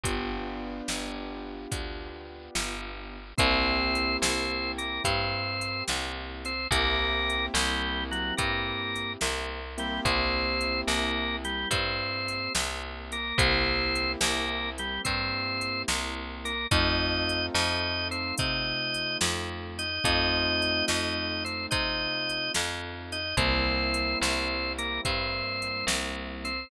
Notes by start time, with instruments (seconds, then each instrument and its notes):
0.03 electric bass (finger) G1, acoustic grand piano B3 D4 F4 G4, kick, closed hi-hat
0.88 electric bass (finger) G1, snare
1.72 electric bass (finger) D2, kick, closed hi-hat
2.55 electric bass (finger) G1, snare
3.38 electric bass (finger) C2, acoustic grand piano A#3 C4 E4 G4, drawbar organ C4 C5, kick, closed hi-hat
3.95 closed hi-hat
4.22 electric bass (finger) C2, drawbar organ C4 C5, snare
4.78 drawbar organ A#3 A#4, closed hi-hat
5.04 electric bass (finger) G2, drawbar organ C4 C5, kick, closed hi-hat
5.61 closed hi-hat
5.87 electric bass (finger) C2, snare
6.45 drawbar organ C4 C5, closed hi-hat
6.71 electric bass (finger) C2, acoustic grand piano A#3 C4 E4 G4, drawbar organ A#3 A#4, kick, closed hi-hat
7.30 closed hi-hat
7.54 electric bass (finger) C2, drawbar organ G3 G4, snare
8.11 drawbar organ F#3 F#4, closed hi-hat
8.37 electric bass (finger) G2, drawbar organ A#3 A#4, kick, closed hi-hat
8.95 closed hi-hat
9.21 electric bass (finger) C2, snare
9.78 drawbar organ G3 G4, acoustic grand piano A#3 C4 E4 G4, closed hi-hat
10.05 electric bass (finger) C2, drawbar organ C4 C5, kick, closed hi-hat
10.61 closed hi-hat
10.87 electric bass (finger) C2, drawbar organ A#3 A#4, snare
11.44 drawbar organ G3 G4, closed hi-hat
11.71 electric bass (finger) G2, drawbar organ C4 C5, kick, closed hi-hat
12.28 closed hi-hat
12.55 electric bass (finger) C2, snare
13.12 drawbar organ A#3 A#4, closed hi-hat
13.38 electric bass (finger) C2, acoustic grand piano A#3 C4 E4 G4, drawbar organ C4 C5, kick, closed hi-hat
13.95 closed hi-hat
14.21 electric bass (finger) C2, drawbar organ A#3 A#4, snare
14.78 drawbar organ G3 G4, closed hi-hat
15.05 electric bass (finger) G2, drawbar organ C4 C5, kick, closed hi-hat
15.61 closed hi-hat
15.88 electric bass (finger) C2, snare
16.45 drawbar organ A#3 A#4, closed hi-hat
16.71 electric bass (finger) F2, acoustic grand piano A3 C4 D#4 F4, drawbar organ D#4 D#5, kick, closed hi-hat
17.29 closed hi-hat
17.54 electric bass (finger) F2, drawbar organ D#4 D#5, snare
18.11 drawbar organ C4 C5, closed hi-hat
18.37 electric bass (finger) C3, drawbar organ D#4 D#5, kick, closed hi-hat
18.94 closed hi-hat
19.21 electric bass (finger) F2, snare
19.79 drawbar organ D#4 D#5, closed hi-hat
20.04 electric bass (finger) F2, acoustic grand piano A3 C4 D#4 F4, drawbar organ D#4 D#5, kick, closed hi-hat
20.62 closed hi-hat
20.88 electric bass (finger) F2, drawbar organ D#4 D#5, snare
21.45 drawbar organ C4 C5, closed hi-hat
21.71 electric bass (finger) C3, drawbar organ D#4 D#5, kick, closed hi-hat
22.29 closed hi-hat
22.54 electric bass (finger) F2, snare
23.12 drawbar organ D#4 D#5, closed hi-hat
23.37 electric bass (finger) C2, acoustic grand piano G3 A#3 C4 E4, drawbar organ C4 C5, kick, closed hi-hat
23.94 closed hi-hat
24.21 electric bass (finger) C2, drawbar organ C4 C5, snare
24.78 drawbar organ A#3 A#4, closed hi-hat
25.05 electric bass (finger) G2, drawbar organ C4 C5, kick, closed hi-hat
25.62 closed hi-hat
25.87 electric bass (finger) C2, snare
26.45 drawbar organ C4 C5, closed hi-hat